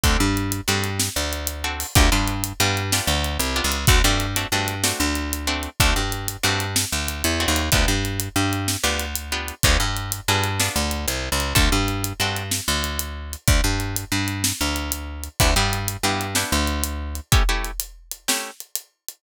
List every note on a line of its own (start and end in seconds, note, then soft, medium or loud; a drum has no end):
0.03 0.17 D2 medium
0.03 0.26 C4 medium
0.03 0.26 D4 medium
0.03 0.26 F#4 medium
0.03 0.26 A4 medium
0.03 kick medium
0.03 closed hi-hat medium
0.20 0.61 G2 medium
0.37 closed hi-hat medium
0.52 closed hi-hat medium
0.68 1.09 G2 medium
0.68 0.90 C4 medium
0.68 0.90 D4 medium
0.68 0.90 F#4 medium
0.68 0.90 A4 medium
0.84 closed hi-hat medium
0.99 snare medium
1.16 1.84 D2 medium
1.33 closed hi-hat medium
1.47 closed hi-hat medium
1.64 1.86 C4 medium
1.64 1.86 D4 medium
1.64 1.86 F#4 medium
1.64 1.86 A4 medium
1.80 open hi-hat medium
1.95 2.10 D2 loud
1.95 2.07 B3 loud
1.95 2.07 D4 loud
1.95 2.07 F4 loud
1.95 2.07 G4 loud
1.95 kick loud
1.95 closed hi-hat medium
2.12 2.53 G2 medium
2.12 2.34 B3 medium
2.12 2.34 D4 medium
2.12 2.34 F4 medium
2.12 2.34 G4 medium
2.28 closed hi-hat medium
2.44 closed hi-hat medium
2.60 3.01 G2 loud
2.60 2.83 B3 medium
2.60 2.83 D4 medium
2.60 2.83 F4 medium
2.60 2.83 G4 medium
2.77 closed hi-hat medium
2.92 3.15 B3 medium
2.92 3.15 D4 medium
2.92 3.15 F4 medium
2.92 3.15 G4 medium
2.92 snare medium
3.07 3.38 D2 medium
3.24 closed hi-hat medium
3.39 3.61 C2 medium
3.39 closed hi-hat loud
3.56 3.78 B3 medium
3.56 3.78 D4 medium
3.56 3.78 F4 medium
3.56 3.78 G4 medium
3.64 3.86 C#2 medium
3.72 closed hi-hat medium
3.87 4.02 D2 loud
3.87 3.99 A3 medium
3.87 3.99 C4 medium
3.87 3.99 D4 medium
3.87 3.99 F#4 medium
3.87 kick loud
3.87 closed hi-hat medium
4.04 4.45 G2 medium
4.04 4.27 A3 medium
4.04 4.27 C4 medium
4.04 4.27 D4 medium
4.04 4.27 F#4 medium
4.20 closed hi-hat medium
4.36 4.47 A3 medium
4.36 4.47 C4 medium
4.36 4.47 D4 medium
4.36 4.47 F#4 medium
4.36 closed hi-hat medium
4.52 4.93 G2 medium
4.52 4.75 A3 medium
4.52 4.75 C4 medium
4.52 4.75 D4 medium
4.52 4.75 F#4 medium
4.68 closed hi-hat medium
4.84 5.06 A3 medium
4.84 5.06 C4 medium
4.84 5.06 D4 medium
4.84 5.06 F#4 medium
4.84 snare loud
5.00 5.68 D2 medium
5.15 closed hi-hat medium
5.33 closed hi-hat medium
5.47 5.70 A3 medium
5.47 5.70 C4 medium
5.47 5.70 D4 medium
5.47 5.70 F#4 medium
5.63 closed hi-hat medium
5.80 5.94 D2 loud
5.80 6.03 A3 medium
5.80 6.03 C4 medium
5.80 6.03 D4 medium
5.80 6.03 F#4 medium
5.80 kick medium
5.80 closed hi-hat medium
5.96 6.37 G2 medium
6.12 closed hi-hat medium
6.28 closed hi-hat medium
6.43 6.85 G2 medium
6.43 6.66 A3 medium
6.43 6.66 C4 medium
6.43 6.66 D4 medium
6.43 6.66 F#4 medium
6.60 closed hi-hat medium
6.76 snare loud
6.92 7.23 D2 medium
7.08 closed hi-hat medium
7.24 7.46 E2 medium
7.24 closed hi-hat medium
7.40 7.62 A3 medium
7.40 7.62 C4 medium
7.40 7.62 D4 medium
7.40 7.62 F#4 medium
7.48 7.70 D#2 medium
7.56 closed hi-hat medium
7.72 7.86 D2 medium
7.72 7.95 B3 loud
7.72 7.95 D4 loud
7.72 7.95 F4 medium
7.72 7.95 G4 loud
7.72 kick medium
7.72 closed hi-hat medium
7.88 8.29 G2 medium
8.05 closed hi-hat medium
8.20 closed hi-hat medium
8.36 8.77 G2 medium
8.53 closed hi-hat medium
8.68 snare medium
8.83 9.52 D2 medium
8.83 9.06 B3 medium
8.83 9.06 D4 medium
8.83 9.06 F4 medium
8.83 9.06 G4 medium
8.99 closed hi-hat medium
9.15 closed hi-hat loud
9.32 9.54 B3 medium
9.32 9.54 D4 medium
9.32 9.54 F4 medium
9.32 9.54 G4 medium
9.48 closed hi-hat medium
9.63 9.77 D2 loud
9.63 9.87 B3 medium
9.63 9.87 D4 medium
9.63 9.87 F4 medium
9.63 9.87 G#4 loud
9.63 kick medium
9.63 closed hi-hat medium
9.80 10.21 G2 medium
9.97 closed hi-hat medium
10.12 closed hi-hat loud
10.28 10.69 G2 medium
10.28 10.51 B3 medium
10.28 10.51 D4 medium
10.28 10.51 F4 medium
10.28 10.51 G#4 medium
10.44 closed hi-hat medium
10.60 10.83 B3 medium
10.60 10.83 D4 medium
10.60 10.83 F4 medium
10.60 10.83 G#4 medium
10.60 snare medium
10.76 11.06 D2 medium
10.91 closed hi-hat medium
11.08 11.29 C2 medium
11.08 closed hi-hat loud
11.32 11.54 C#2 medium
11.40 closed hi-hat medium
11.55 11.69 D2 medium
11.55 11.77 C4 medium
11.55 11.77 D4 loud
11.55 11.77 F#4 loud
11.55 11.77 A4 loud
11.55 kick medium
11.55 closed hi-hat medium
11.72 12.13 G2 medium
11.88 closed hi-hat medium
12.04 closed hi-hat medium
12.20 12.60 G2 medium
12.20 12.43 C4 medium
12.20 12.43 D4 medium
12.20 12.43 F#4 medium
12.20 12.43 A4 medium
12.36 closed hi-hat medium
12.51 snare medium
12.68 13.36 D2 medium
12.84 closed hi-hat medium
12.99 closed hi-hat medium
13.33 closed hi-hat medium
13.48 13.61 D2 medium
13.48 kick medium
13.48 closed hi-hat medium
13.64 14.05 G2 medium
13.80 closed hi-hat medium
13.96 closed hi-hat medium
14.12 14.52 G2 medium
14.28 closed hi-hat medium
14.44 snare loud
14.61 15.29 D2 medium
14.76 closed hi-hat medium
14.92 closed hi-hat loud
15.24 closed hi-hat medium
15.40 15.54 D2 medium
15.40 15.51 B3 loud
15.40 15.51 D4 medium
15.40 15.51 E4 medium
15.40 15.51 G4 medium
15.40 kick medium
15.40 closed hi-hat medium
15.56 15.97 G2 medium
15.56 15.79 B3 medium
15.56 15.79 D4 medium
15.56 15.79 E4 medium
15.56 15.79 G4 medium
15.73 closed hi-hat medium
15.88 closed hi-hat medium
16.03 16.44 G2 medium
16.03 16.27 B3 medium
16.03 16.27 D4 medium
16.03 16.27 E4 medium
16.03 16.27 G4 medium
16.21 closed hi-hat medium
16.35 16.58 B3 medium
16.35 16.58 D4 medium
16.35 16.58 E4 medium
16.35 16.58 G4 medium
16.35 snare medium
16.52 17.20 D2 medium
16.67 closed hi-hat medium
16.84 closed hi-hat medium
17.15 closed hi-hat medium
17.32 17.43 A3 medium
17.32 17.43 C#4 loud
17.32 17.43 E4 loud
17.32 17.43 G4 loud
17.32 kick loud
17.32 closed hi-hat medium
17.49 17.71 A3 medium
17.49 17.71 C#4 medium
17.49 17.71 E4 medium
17.49 17.71 G4 medium
17.64 closed hi-hat medium
17.80 closed hi-hat loud
18.11 closed hi-hat medium
18.28 18.51 A3 medium
18.28 18.51 C#4 medium
18.28 18.51 E4 medium
18.28 18.51 G4 medium
18.28 snare loud
18.60 closed hi-hat medium
18.75 closed hi-hat medium
19.08 closed hi-hat medium